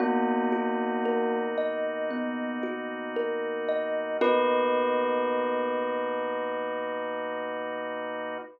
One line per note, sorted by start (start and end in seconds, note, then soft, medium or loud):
0.00 4.17 B2 loud
0.00 1.37 A#3 medium
0.00 4.17 A#3 loud
0.00 2.10 B3 medium
0.00 4.17 D#4 loud
0.00 1.37 F#4 medium
0.00 4.17 F#4 loud
0.52 2.63 F#4 medium
1.05 3.16 A#4 medium
1.58 3.68 D#5 medium
2.11 4.11 B3 medium
2.63 4.13 F#4 medium
3.16 4.16 A#4 medium
3.68 4.18 D#5 medium
4.21 8.38 B2 loud
4.21 8.38 A#3 loud
4.21 8.38 B3 loud
4.21 8.38 D#4 medium
4.21 8.38 F#4 loud
4.21 8.38 A#4 loud
4.21 8.38 B4 loud
4.21 8.38 D#5 loud